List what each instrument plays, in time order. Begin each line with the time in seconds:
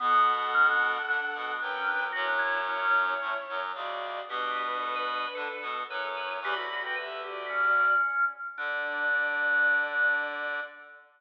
0.00 clarinet B2 B3, drawbar organ B3, violin A4 F#5
0.54 drawbar organ C#4
0.69 drawbar organ D4
1.08 clarinet D3 D4, drawbar organ D4
1.35 clarinet B2 B3
1.60 clarinet F#2 F#3, drawbar organ D4, violin B4 G5
1.76 drawbar organ C#4
1.87 drawbar organ D4
2.12 clarinet F#2 F#3, violin E4 C#5, drawbar organ F#4
2.27 drawbar organ D4
2.39 drawbar organ E4
2.69 drawbar organ C#4
3.21 clarinet A2 A3
3.49 clarinet F#2 F#3
3.75 clarinet C#2 C#3, violin F#4 D5
4.27 clarinet B2 B3, violin D4 B4, drawbar organ G4
4.82 drawbar organ A4
4.96 drawbar organ B4
5.35 clarinet D3 D4, drawbar organ A4
5.62 clarinet B2 B3
5.88 clarinet F#2 F#3, violin E4 C#5, drawbar organ B4
6.05 drawbar organ A4
6.17 drawbar organ B4
6.42 clarinet E2 E3, drawbar organ G4, violin D5 B5
6.56 clarinet D2 D3, drawbar organ F#4
6.70 drawbar organ F#4
6.82 drawbar organ F#4, violin B4 G5
6.96 violin G4 E5, drawbar organ B4
7.24 violin F#4 D5, drawbar organ G4
7.49 drawbar organ C#4
8.57 clarinet D3, drawbar organ D4, violin D5